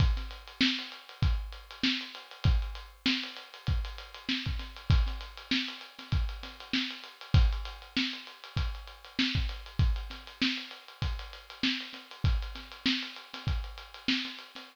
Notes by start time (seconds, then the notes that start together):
0.00 kick, closed hi-hat
0.17 snare, closed hi-hat
0.31 closed hi-hat
0.47 closed hi-hat
0.61 snare
0.79 closed hi-hat
0.92 closed hi-hat
1.09 closed hi-hat
1.22 kick, closed hi-hat
1.52 closed hi-hat
1.71 closed hi-hat
1.83 snare
2.01 closed hi-hat
2.15 closed hi-hat
2.31 closed hi-hat
2.44 kick, closed hi-hat
2.62 closed hi-hat
2.75 closed hi-hat
3.06 snare, closed hi-hat
3.23 closed hi-hat
3.36 closed hi-hat
3.54 closed hi-hat
3.67 kick, closed hi-hat
3.85 closed hi-hat
3.98 closed hi-hat
4.14 closed hi-hat
4.29 snare
4.46 kick, closed hi-hat
4.59 snare, closed hi-hat
4.76 closed hi-hat
4.90 kick, closed hi-hat
5.07 snare, closed hi-hat
5.21 closed hi-hat
5.37 closed hi-hat
5.51 snare
5.68 closed hi-hat
5.81 closed hi-hat
5.99 snare, closed hi-hat
6.12 kick, closed hi-hat
6.29 closed hi-hat
6.43 snare, closed hi-hat
6.60 closed hi-hat
6.73 snare
6.90 closed hi-hat
7.04 closed hi-hat
7.21 closed hi-hat
7.34 kick, closed hi-hat
7.53 closed hi-hat
7.65 closed hi-hat
7.82 closed hi-hat
7.97 snare
8.13 closed hi-hat
8.27 closed hi-hat
8.44 closed hi-hat
8.57 kick, closed hi-hat
8.75 closed hi-hat
8.87 closed hi-hat
9.04 closed hi-hat
9.19 snare
9.35 kick, closed hi-hat
9.49 closed hi-hat
9.66 closed hi-hat
9.79 kick, closed hi-hat
9.96 closed hi-hat
10.10 snare, closed hi-hat
10.27 closed hi-hat
10.42 snare
10.57 closed hi-hat
10.71 closed hi-hat
10.88 closed hi-hat
11.02 kick, closed hi-hat
11.19 closed hi-hat
11.33 closed hi-hat
11.50 closed hi-hat
11.63 snare
11.80 closed hi-hat
11.93 snare, closed hi-hat
12.11 closed hi-hat
12.24 kick, closed hi-hat
12.42 closed hi-hat
12.55 snare, closed hi-hat
12.72 closed hi-hat
12.86 snare
13.03 closed hi-hat
13.16 closed hi-hat
13.34 snare, closed hi-hat
13.47 kick, closed hi-hat
13.64 closed hi-hat
13.78 closed hi-hat
13.94 closed hi-hat
14.08 snare
14.25 snare, closed hi-hat
14.39 closed hi-hat
14.55 snare, closed hi-hat